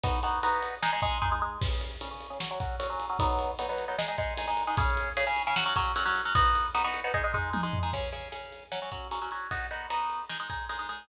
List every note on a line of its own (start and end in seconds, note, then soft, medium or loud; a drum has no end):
0.04 0.19 B3 loud
0.04 0.19 D#4 loud
0.04 0.19 F#4 loud
0.04 kick loud
0.04 ride loud
0.23 0.39 B3 medium
0.23 0.39 D#4 medium
0.23 0.39 F#4 medium
0.23 ride medium
0.43 0.75 B3 medium
0.43 0.75 D#4 medium
0.43 0.75 F#4 medium
0.43 ride medium
0.63 ride medium
0.82 0.90 G#3 loud
0.82 0.90 D#4 loud
0.82 0.90 G#4 medium
0.82 snare loud
0.93 1.01 G#3 medium
0.93 1.01 D#4 medium
0.93 1.01 G#4 medium
1.02 1.18 G#3 medium
1.02 1.18 D#4 medium
1.02 1.18 G#4 medium
1.02 kick medium
1.02 ride medium
1.22 1.30 G#3 medium
1.22 1.30 D#4 medium
1.22 1.30 G#4 medium
1.22 kick medium
1.22 floor tom medium
1.32 1.40 G#3 medium
1.32 1.40 D#4 medium
1.32 1.40 G#4 medium
1.42 1.58 G#3 medium
1.42 1.58 D#4 medium
1.42 1.58 G#4 medium
1.61 1.93 C#3 loud
1.61 1.93 C#4 medium
1.61 1.93 G#4 loud
1.61 kick loud
1.61 crash loud
1.81 ride medium
2.01 2.09 C#3 medium
2.01 2.09 C#4 medium
2.01 2.09 G#4 medium
2.01 ride loud
2.11 2.27 C#3 medium
2.11 2.27 C#4 medium
2.11 2.27 G#4 medium
2.21 ride medium
2.30 2.38 C#3 medium
2.30 2.38 C#4 medium
2.30 2.38 G#4 medium
2.40 2.48 F#3 medium
2.40 2.48 C#4 loud
2.40 2.48 F#4 medium
2.40 snare loud
2.51 2.59 F#3 medium
2.51 2.59 C#4 medium
2.51 2.59 F#4 medium
2.60 2.76 F#3 medium
2.60 2.76 C#4 medium
2.60 2.76 F#4 medium
2.60 kick medium
2.60 ride medium
2.80 2.87 F#3 medium
2.80 2.87 C#4 medium
2.80 2.87 F#4 medium
2.80 ride loud
2.90 3.05 F#3 medium
2.90 3.05 C#4 medium
2.90 3.05 F#4 medium
3.00 ride medium
3.09 3.17 F#3 medium
3.09 3.17 C#4 medium
3.09 3.17 F#4 medium
3.19 3.51 F#3 medium
3.19 3.51 B3 loud
3.19 3.51 D#4 medium
3.19 kick loud
3.19 ride loud
3.39 ride medium
3.59 3.67 F#3 medium
3.59 3.67 B3 medium
3.59 3.67 D#4 medium
3.59 ride loud
3.69 3.85 F#3 medium
3.69 3.85 B3 medium
3.69 3.85 D#4 medium
3.78 ride medium
3.88 3.96 F#3 medium
3.88 3.96 B3 medium
3.88 3.96 D#4 medium
3.98 4.06 G#3 medium
3.98 4.06 D#4 loud
3.98 4.06 G#4 loud
3.98 snare loud
4.08 4.16 G#3 medium
4.08 4.16 D#4 medium
4.08 4.16 G#4 medium
4.18 4.34 G#3 medium
4.18 4.34 D#4 medium
4.18 4.34 G#4 medium
4.18 kick medium
4.18 ride medium
4.38 4.46 G#3 medium
4.38 4.46 D#4 medium
4.38 4.46 G#4 medium
4.38 ride loud
4.48 4.63 G#3 medium
4.48 4.63 D#4 medium
4.48 4.63 G#4 medium
4.57 ride medium
4.67 4.75 G#3 medium
4.67 4.75 D#4 medium
4.67 4.75 G#4 medium
4.77 5.09 C#3 loud
4.77 5.09 C#4 medium
4.77 5.09 G#4 loud
4.77 kick loud
4.77 ride loud
4.97 ride medium
5.17 5.25 C#3 medium
5.17 5.25 C#4 medium
5.17 5.25 G#4 medium
5.17 ride loud
5.27 5.43 C#3 medium
5.27 5.43 C#4 medium
5.27 5.43 G#4 medium
5.36 ride medium
5.47 5.55 C#3 medium
5.47 5.55 C#4 medium
5.47 5.55 G#4 medium
5.56 5.64 F#3 medium
5.56 5.64 C#4 loud
5.56 5.64 F#4 loud
5.56 snare loud
5.66 5.74 F#3 medium
5.66 5.74 C#4 medium
5.66 5.74 F#4 medium
5.76 5.92 F#3 medium
5.76 5.92 C#4 medium
5.76 5.92 F#4 medium
5.76 kick medium
5.76 ride medium
5.96 6.04 F#3 medium
5.96 6.04 C#4 medium
5.96 6.04 F#4 medium
5.96 ride loud
6.06 6.21 F#3 medium
6.06 6.21 C#4 medium
6.06 6.21 F#4 medium
6.16 ride medium
6.25 6.33 F#3 medium
6.25 6.33 C#4 medium
6.25 6.33 F#4 medium
6.35 6.67 B3 loud
6.35 6.67 D#4 medium
6.35 6.67 F#4 medium
6.35 kick loud
6.35 ride loud
6.55 ride medium
6.75 6.82 B3 medium
6.75 6.82 D#4 medium
6.75 6.82 F#4 medium
6.75 ride loud
6.84 7.00 B3 medium
6.84 7.00 D#4 medium
6.84 7.00 F#4 medium
6.94 ride medium
7.04 7.12 B3 medium
7.04 7.12 D#4 medium
7.04 7.12 F#4 medium
7.14 7.22 G#3 loud
7.14 7.22 D#4 loud
7.14 7.22 G#4 loud
7.14 kick medium
7.24 7.32 G#3 medium
7.24 7.32 D#4 medium
7.24 7.32 G#4 medium
7.34 7.50 G#3 medium
7.34 7.50 D#4 medium
7.34 7.50 G#4 medium
7.34 floor tom medium
7.53 7.61 G#3 medium
7.53 7.61 D#4 medium
7.53 7.61 G#4 medium
7.53 high tom medium
7.63 7.79 G#3 medium
7.63 7.79 D#4 medium
7.63 7.79 G#4 medium
7.73 floor tom loud
7.83 7.91 G#3 medium
7.83 7.91 D#4 medium
7.83 7.91 G#4 medium
7.93 8.09 C#3 medium
7.93 8.09 C#4 medium
7.93 8.09 G#4 medium
7.93 kick medium
7.93 crash medium
8.12 8.28 C#3 medium
8.12 8.28 C#4 medium
8.12 8.28 G#4 medium
8.12 ride medium
8.32 8.64 C#3 medium
8.32 8.64 C#4 medium
8.32 8.64 G#4 medium
8.32 ride medium
8.53 ride medium
8.72 8.80 F#3 medium
8.72 8.80 C#4 medium
8.72 8.80 F#4 medium
8.72 snare medium
8.82 8.90 F#3 medium
8.82 8.90 C#4 medium
8.82 8.90 F#4 medium
8.92 9.07 F#3 medium
8.92 9.07 C#4 medium
8.92 9.07 F#4 medium
8.92 kick medium
8.92 ride medium
9.11 9.19 F#3 medium
9.11 9.19 C#4 medium
9.11 9.19 F#4 medium
9.11 ride medium
9.22 9.30 F#3 medium
9.22 9.30 C#4 medium
9.22 9.30 F#4 medium
9.31 9.47 F#3 medium
9.31 9.47 C#4 medium
9.31 9.47 F#4 medium
9.31 ride soft
9.51 9.67 B3 medium
9.51 9.67 D#4 medium
9.51 9.67 F#4 medium
9.51 kick medium
9.51 ride medium
9.71 9.87 B3 medium
9.71 9.87 D#4 medium
9.71 9.87 F#4 medium
9.71 ride soft
9.90 10.22 B3 medium
9.90 10.22 D#4 medium
9.90 10.22 F#4 medium
9.90 ride medium
10.10 ride soft
10.30 10.37 G#3 medium
10.30 10.37 D#4 medium
10.30 10.37 G#4 medium
10.30 snare medium
10.40 10.48 G#3 medium
10.40 10.48 D#4 medium
10.40 10.48 G#4 medium
10.50 10.65 G#3 medium
10.50 10.65 D#4 medium
10.50 10.65 G#4 medium
10.50 kick medium
10.50 ride medium
10.69 10.77 G#3 medium
10.69 10.77 D#4 medium
10.69 10.77 G#4 medium
10.69 ride medium
10.79 10.87 G#3 medium
10.79 10.87 D#4 medium
10.79 10.87 G#4 medium
10.89 11.05 G#3 soft
10.89 11.05 D#4 medium
10.89 11.05 G#4 medium
10.89 ride soft